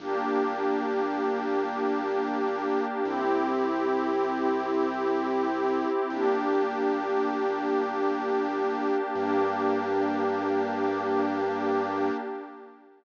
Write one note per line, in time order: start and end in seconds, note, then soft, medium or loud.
0.00 2.81 G1 loud
0.00 3.02 A#3 loud
0.00 3.02 D4 medium
0.00 3.02 G4 loud
3.05 5.86 C2 loud
3.05 6.07 C4 loud
3.05 6.07 E4 medium
3.05 6.07 G4 loud
6.10 8.91 G1 loud
6.10 9.12 A#3 medium
6.10 9.12 D4 loud
6.10 9.12 G4 loud
9.15 12.11 G2 loud
9.15 12.10 A#3 loud
9.15 12.10 D4 loud
9.15 12.10 G4 loud